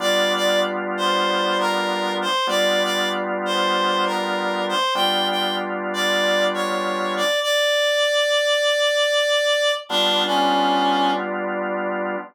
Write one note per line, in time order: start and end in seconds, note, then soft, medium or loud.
0.00 2.26 G3 loud
0.00 2.26 B3 loud
0.00 2.26 D4 medium
0.00 2.26 F4 loud
0.00 0.33 D5 loud
0.36 0.60 D5 loud
0.97 1.58 C5 loud
1.60 2.13 A#4 loud
2.22 2.47 C5 loud
2.47 4.74 G3 loud
2.47 4.74 B3 loud
2.47 4.74 D4 medium
2.47 4.74 F4 loud
2.47 2.83 D5 loud
2.84 3.09 D5 loud
3.45 4.05 C5 loud
4.06 4.63 A#4 medium
4.69 4.94 C5 loud
4.95 7.22 G3 loud
4.95 7.22 B3 loud
4.95 7.22 D4 loud
4.95 7.22 F4 loud
4.95 5.28 G5 loud
5.30 5.56 G5 medium
5.94 6.44 D5 loud
6.54 7.14 C#5 medium
7.17 7.40 D5 loud
7.42 9.72 D5 loud
9.89 12.16 G3 loud
9.89 12.16 B3 loud
9.89 10.23 D4 loud
9.89 12.16 D4 loud
9.89 12.16 F4 loud
10.26 11.11 C#4 medium